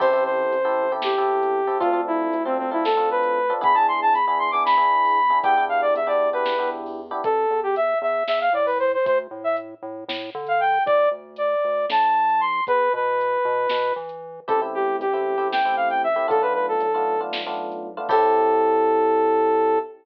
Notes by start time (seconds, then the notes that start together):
0.00 A1 C4 E4 G4 A4 C5, kick, crash
0.13 C4 E4 G4 A4
0.25 C5
0.52 A1, closed hi-hat
0.65 C4 E4 G4 A4
0.92 C4 E4 G4 A4
1.02 G4, snare
1.18 C4 E4 G4 A4
1.43 closed hi-hat
1.67 C4 E4 G4 A4
1.80 D2 C4 D4 F4 A4, kick, closed hi-hat
1.93 C4 D4 F4 A4
2.07 E4
2.33 D2, closed hi-hat
2.45 C4 D4 F4 A4
2.58 C4
2.71 C4 D4 E4 F4 A4
2.85 A4, snare
2.97 C4 D4 F4 A4
3.11 B4
3.23 closed hi-hat
3.50 C4 D4 F4 A4
3.61 E2 B3 D4 E4 G#4 B5, kick, closed hi-hat
3.74 B3 D4 E4 G#4 A5
3.88 C6
4.02 A5
4.14 E2 B5, closed hi-hat
4.26 B3 D4 E4 G#4 B5
4.39 C6
4.51 B3 D4 E4 G#4 D6
4.65 B5, snare
4.77 B3 D4 E4 G#4
5.05 open hi-hat
5.30 B3 D4 E4 G#4
5.43 E2 B3 D4 E4 G4 G5, kick, closed hi-hat
5.57 B3 D4 E4 G4
5.69 F5
5.82 D5
5.94 E2 E5, closed hi-hat
6.07 B3 D4 E4 G4 D5
6.33 B3 D4 E4 G4 B4
6.45 snare
6.58 B3 D4 E4 G4
6.86 open hi-hat
7.11 B3 D4 E4 G4
7.24 A1 A4, kick, closed hi-hat
7.50 E2
7.63 G4
7.76 E5, closed hi-hat
8.02 E2 E5
8.27 E2 E5, snare
8.41 F5
8.53 A2 D5
8.66 B4, open hi-hat
8.79 C5
8.94 C5
9.05 D2 C5, kick, closed hi-hat
9.31 A2
9.44 E5
9.57 closed hi-hat
9.82 A2
10.08 A2, snare
10.35 D3
10.46 F5, closed hi-hat
10.60 G5
10.86 G1 D5, kick, closed hi-hat
11.11 D2
11.36 D5, closed hi-hat
11.64 D2
11.89 B1 A5, snare
12.29 closed hi-hat
12.40 C6
12.67 E2 B4, kick, closed hi-hat
12.93 B2 B4
13.21 closed hi-hat
13.45 B2
13.69 B2, snare
13.96 E3
14.09 closed hi-hat
14.48 A1 A3 C4 E4 G4 A4, kick, closed hi-hat
14.62 A3 C4 E4 G4
14.74 G4
15.00 A1 G4, closed hi-hat
15.13 A3 C4 E4 G4
15.38 A3 C4 E4 G4
15.52 G5, snare
15.65 A3 C4 E4 G4
15.76 F5
15.90 G5, closed hi-hat
16.04 E5
16.16 A3 C4 E4 G4
16.28 B1 A3 B3 D4 F4 A4, kick, closed hi-hat
16.42 A3 B3 D4 F4 B4
16.54 B4
16.68 A4
16.80 B1, closed hi-hat
16.94 A3 B3 D4 F4
17.21 A3 B3 D4 F4
17.33 snare
17.46 A3 B3 D4 F4
17.72 closed hi-hat
17.97 A3 B3 D4 F4
18.09 A2 C4 E4 G4 A4, kick, crash